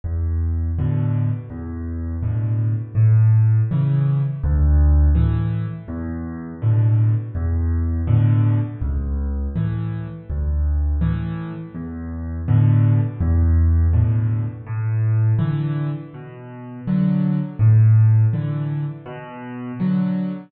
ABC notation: X:1
M:4/4
L:1/8
Q:1/4=82
K:A
V:1 name="Acoustic Grand Piano" clef=bass
E,,2 [A,,B,,D,]2 E,,2 [A,,B,,D,]2 | A,,2 [C,E,]2 D,,2 [A,,E,]2 | E,,2 [A,,B,,D,]2 E,,2 [A,,B,,D,]2 | C,,2 [A,,E,]2 D,,2 [A,,E,]2 |
E,,2 [A,,B,,D,]2 E,,2 [A,,B,,D,]2 | A,,2 [D,E,]2 B,,2 [D,F,]2 | A,,2 [D,E,]2 B,,2 [D,F,]2 |]